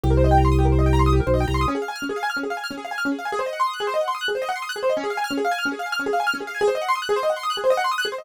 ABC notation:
X:1
M:6/8
L:1/16
Q:3/8=146
K:Dblyd
V:1 name="Acoustic Grand Piano"
G B c e g b c' e' G B c e | g b c' e' G B c e g b c' e' | D A f a f' D A f a f' D A | f a f' D A f a f' D A f a |
A c e _g c' e' _g' A c e g c' | e' _g' A c e _g c' e' g' A c e | D A f a f' D A f a f' D A | f a f' D A f a f' D A f a |
A c e _g c' e' _g' A c e g c' | e' _g' A c e _g c' e' g' A c e |]
V:2 name="Drawbar Organ" clef=bass
C,,12- | C,,6 =B,,,3 C,,3 | z12 | z12 |
z12 | z12 | z12 | z12 |
z12 | z12 |]